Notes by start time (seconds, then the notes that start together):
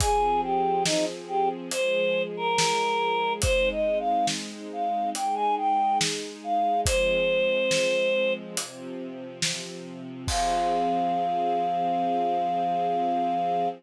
0.00 F3 C4 G#4, kick, closed hi-hat
0.43 G4
0.85 D#4, snare
1.28 G4
1.71 F3 G#3 G#4 C5, closed hi-hat
2.37 A#4
2.58 snare
3.42 G#3 C4 D#4 C5, kick, closed hi-hat
3.71 D#5
3.99 F5
4.27 snare
4.73 F5
5.14 G#3 D#4 G#4 G5, closed hi-hat
5.35 G#5
5.57 G5
6.01 snare
6.44 F5
6.86 F3 G#3 C4 C5, kick, closed hi-hat
7.71 snare
8.57 C3 F3 C4, closed hi-hat
9.42 snare
10.28 F3 C4 G#4 F5, kick, crash